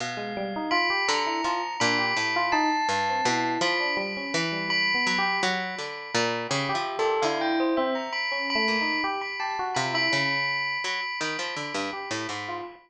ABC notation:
X:1
M:5/8
L:1/16
Q:1/4=83
K:none
V:1 name="Tubular Bells"
f4 b2 ^a4 | b4 a6 | b2 b2 b2 b4 | b6 (3b2 e2 A2 |
f g c e ^a b2 b3 | b b a z b b5 | b2 b8 |]
V:2 name="Electric Piano 1"
z ^G, =G, ^D F G z E F z | D G z F ^D z2 C E2 | F D G, ^C z G, (3G,2 B,2 G2 | z6 G G2 G |
E3 C z2 (3^C2 A,2 ^D2 | G z G ^F =F E ^C z3 | z6 G z2 F |]
V:3 name="Pizzicato Strings" clef=bass
B,,6 D,2 F,2 | ^A,,2 =A,,4 G,,2 B,,2 | F,4 E,4 ^F,2 | ^F,2 D,2 ^A,,2 (3^C,2 =F,2 A,,2 |
D,6 z2 ^A,,2 | z4 C,2 ^C,4 | ^F, z ^D, =F, =D, G,, z A,, ^G,,2 |]